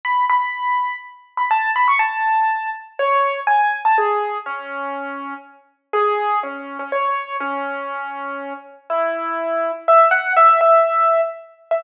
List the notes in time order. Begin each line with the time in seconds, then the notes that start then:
0.05 B5
0.30 B5
1.37 B5
1.51 A5
1.76 B5
1.88 C#6
1.99 A5
2.99 C#5
3.47 G#5
3.85 A5
3.98 G#4
4.46 C#4
5.93 G#4
6.43 C#4
6.79 C#4
6.92 C#5
7.40 C#4
8.90 E4
9.88 E5
10.11 F#5
10.36 E5
10.61 E5
11.71 E5